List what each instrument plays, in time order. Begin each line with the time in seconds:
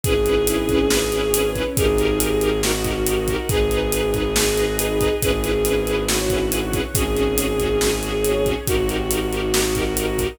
0.04 violin G#1 G#4, string ensemble 1 C#4 E4 G#4 B4, kick, closed hi-hat
0.26 string ensemble 1 C#4 E4 G#4 B4, closed hi-hat
0.47 string ensemble 1 C#4 E4 G#4 B4, closed hi-hat
0.69 string ensemble 1 C#4 E4 G#4 B4, kick, closed hi-hat
0.90 string ensemble 1 C#4 E4 G#4 B4 C#5, snare
1.12 string ensemble 1 C#4 E4 G#4 B4, closed hi-hat
1.33 string ensemble 1 C#4 E4 G#4 B4, closed hi-hat
1.55 string ensemble 1 C#4 E4 G#4 B4, kick, closed hi-hat
1.77 violin G#1 G#4, string ensemble 1 D#4 G4 A#4, kick, closed hi-hat
1.98 string ensemble 1 D#4 G4 A#4, closed hi-hat
2.20 string ensemble 1 D#4 G4 A#4, closed hi-hat
2.41 string ensemble 1 D#4 G4 A#4, closed hi-hat
2.63 string ensemble 1 D#4 G4 A#4 D#5, violin F#4, snare
2.84 string ensemble 1 D#4 G4 A#4, kick, closed hi-hat
3.06 string ensemble 1 D#4 G4 A#4, closed hi-hat
3.28 string ensemble 1 D#4 G4 A#4, kick, closed hi-hat
3.48 violin G#1 G#4, string ensemble 1 D#4 G#4 B4, kick, closed hi-hat
3.71 string ensemble 1 D#4 G#4 B4, closed hi-hat
3.92 string ensemble 1 D#4 G#4 B4, closed hi-hat
4.14 string ensemble 1 D#4 G#4 B4, kick, closed hi-hat
4.35 string ensemble 1 D#4 G#4 B4 D#5, snare
4.57 string ensemble 1 D#4 G#4 B4, closed hi-hat
4.78 string ensemble 1 D#4 G#4 B4, closed hi-hat
5.00 string ensemble 1 D#4 G#4 B4, kick, closed hi-hat
5.22 violin G#1 G#4, string ensemble 1 C#4 E4 G#4 B4, kick, closed hi-hat
5.43 string ensemble 1 C#4 E4 G#4 B4, closed hi-hat
5.65 string ensemble 1 C#4 E4 G#4 B4, closed hi-hat
5.87 string ensemble 1 C#4 E4 G#4 B4, closed hi-hat
6.08 string ensemble 1 C#4 E4 G#4 B4 C#5, violin F#4, snare
6.30 string ensemble 1 C#4 E4 G#4 B4, kick, closed hi-hat
6.51 string ensemble 1 C#4 E4 G#4 B4, closed hi-hat
6.73 string ensemble 1 C#4 E4 G#4 B4, kick, closed hi-hat
6.93 violin G#1 G#4, string ensemble 1 C#4 F#4 G#4, kick, closed hi-hat
7.15 string ensemble 1 C#4 F#4 G#4, closed hi-hat
7.37 string ensemble 1 C#4 F#4 G#4, closed hi-hat
7.59 string ensemble 1 C#4 F#4 G#4, kick, closed hi-hat
7.81 string ensemble 1 C#4 F#4 G#4 C#5, snare
8.03 string ensemble 1 C#4 F#4 G#4, closed hi-hat
8.24 string ensemble 1 C#4 F#4 G#4, closed hi-hat
8.46 string ensemble 1 C#4 F#4 G#4, kick, closed hi-hat
8.66 violin G#1 F#4, string ensemble 1 D#4 G4 A#4, kick, closed hi-hat
8.88 string ensemble 1 D#4 G4 A#4, closed hi-hat
9.11 string ensemble 1 D#4 G4 A#4, closed hi-hat
9.32 string ensemble 1 D#4 G4 A#4, closed hi-hat
9.53 string ensemble 1 D#4 G4 A#4 D#5, snare
9.75 string ensemble 1 D#4 G4 A#4, kick, closed hi-hat
9.97 string ensemble 1 D#4 G4 A#4, closed hi-hat
10.19 string ensemble 1 D#4 G4 A#4, kick, closed hi-hat